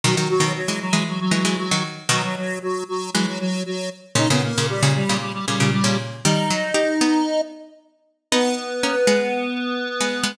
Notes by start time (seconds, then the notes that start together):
0.04 B2 D#3 F#3 F#4
0.16 D#3 F#3 F#4
0.29 F#3 F#4
0.40 B2 D#3
0.56 F#3 F#4
0.68 E3 G#3
0.81 F#3 F#4
0.93 E3 G#3
1.08 F#3 F#4
1.20 F#3 F#4
1.31 E3 F#3 G#3 F#4
1.45 E3 G#3
1.58 F#3 F#4
1.71 D#3 F#3
2.09 B2 D#3 F#3 F#4
2.23 F#3 F#4
2.37 F#3 F#4
2.62 F#3 F#4
2.88 F#3 F#4
3.14 E3 F#3 G#3 F#4
3.27 F#3 F#4
3.39 F#3 F#4
3.66 F#3 F#4
4.15 A#2 C#3 D#4 D#5
4.30 A#2 C#3 B3 B4
4.44 A#3 A#4
4.58 A#2 C#3
4.69 G3 G4
4.82 A#2 C#3
4.95 G3 G4
5.09 A#2 C#3
5.20 G3 G4
5.33 G3 G4
5.47 A#2 C#3 G3 G4
5.60 A#2 C#3
5.72 G3 G4
5.84 A#2 C#3
6.24 D#3 G3 D#4 D#5
6.50 F#3
6.74 D#4 G4
7.01 B3 D#4
8.32 B3 D#4 B4
8.83 A#3 C#4
9.07 G#3 B3
10.00 G#3 B3
10.23 G#3 B3